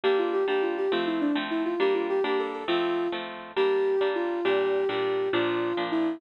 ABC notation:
X:1
M:6/8
L:1/8
Q:3/8=136
K:Gdor
V:1 name="Ocarina"
G F G G F G | F E D z E F | G F G G A A | F3 z3 |
G4 F2 | G3 G3 | F4 E2 |]
V:2 name="Orchestral Harp"
[G,B,D]3 [G,B,D]3 | [F,A,C]3 [F,A,C]3 | [G,B,D]3 [G,B,D]3 | [F,A,C]3 [F,A,C]3 |
[G,B,D]3 [G,B,D]3 | [B,,G,D]3 [B,,G,D]3 | [B,,F,D]3 [B,,F,D]3 |]